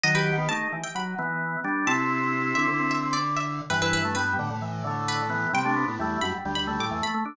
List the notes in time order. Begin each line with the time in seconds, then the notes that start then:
0.04 D#3 F#3 D#5
0.15 G4 B4
0.38 B3
0.49 A3 D#4 A5
0.73 E3
0.83 G5
0.95 F#3 B5
1.19 E3 B3
1.64 G3 D4
1.87 C3 C4 E4 A5
2.55 D3 E5
2.67 D3
2.79 C4
2.91 E5
3.13 D5
3.37 E5
3.70 G2 E3 B4
3.82 E4 B4
3.93 B4
4.05 A3
4.15 G3 B3 B4
4.39 A2 D3
4.50 A2
4.62 E3
4.84 D3 A3
5.08 B4
5.30 E3 B3
5.53 C3 G3 G5
5.65 A3 D4
5.76 B3
5.88 A2
5.99 E2 G3 A3
6.21 F#2 B5
6.45 D2 G3
6.55 D2 B5
6.67 D2 A3
6.79 A2 D6
6.91 E2 E3
7.02 A3 B5
7.14 A3
7.25 D4